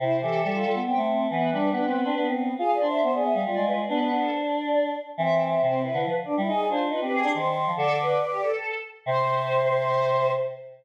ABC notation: X:1
M:3/4
L:1/16
Q:1/4=139
K:C
V:1 name="Choir Aahs"
c2 A6 g2 z2 | B10 z2 | (3f2 d2 e2 c d e f d2 B d | B3 A c d5 z2 |
e3 e c2 B2 B z3 | _e d c z B B _A2 z4 | A2 B2 B G A4 z2 | c12 |]
V:2 name="Choir Aahs"
E2 G2 G F3 C4 | B,2 D2 D C3 B,4 | _A2 c2 c A3 F4 | B,4 z8 |
C4 C2 E E z2 D E | _A2 F2 F G3 c4 | d8 z4 | c12 |]
V:3 name="Choir Aahs"
C,2 E,2 G,2 G, B, B, A,3 | E,2 G,2 B,2 B, D D C3 | F2 D2 B,2 B, G, G, _A,3 | D D D8 z2 |
E,4 C,3 D, F, z2 G, | _E2 D2 E C C D _E,3 F, | D,4 z8 | C,12 |]